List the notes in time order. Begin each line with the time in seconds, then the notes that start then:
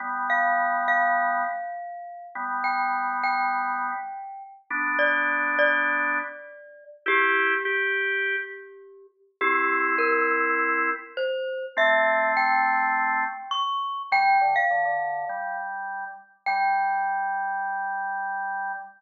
0.00 G3 B3
0.30 F5
0.88 F5
2.35 G3 B3
2.64 G5
3.24 G5
4.70 B3 D4
4.99 D5
5.59 D5
7.06 E4 G4
7.65 G4
9.41 C4 E4 G4
9.98 A#4
11.17 C5
11.77 A3 C4 E5
12.37 G5
13.51 C#6
14.12 G3 G5
14.41 D3
14.56 F5
14.71 D3
14.85 D3
15.29 G3
16.46 G3 G5